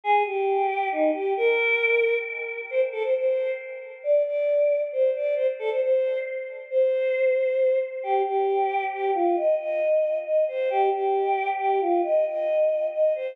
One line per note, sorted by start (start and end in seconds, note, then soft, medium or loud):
0.04 0.23 G#4 loud
0.26 0.89 G4 medium
0.92 1.11 D#4 medium
1.14 1.33 G4 medium
1.37 2.17 A#4 loud
2.70 2.81 C5 medium
2.92 3.03 A4 medium
3.03 3.14 C5 medium
3.15 3.51 C5 medium
4.04 4.22 D5 medium
4.25 4.82 D5 medium
4.92 5.10 C5 medium
5.15 5.35 D5 medium
5.36 5.47 C5 loud
5.59 5.70 A4 medium
5.70 5.81 C5 medium
5.82 6.18 C5 medium
6.71 7.79 C5 medium
8.03 8.22 G4 medium
8.26 8.84 G4 medium
8.93 9.11 G4 medium
9.15 9.36 F4 medium
9.36 9.55 D#5 medium
9.59 10.18 D#5 medium
10.26 10.44 D#5 medium
10.48 10.69 C5 medium
10.70 10.90 G4 loud
10.92 11.50 G4 medium
11.59 11.80 G4 medium
11.81 12.01 F4 medium
12.03 12.25 D#5 loud
12.26 12.87 D#5 medium
12.93 13.13 D#5 medium
13.15 13.35 C5 medium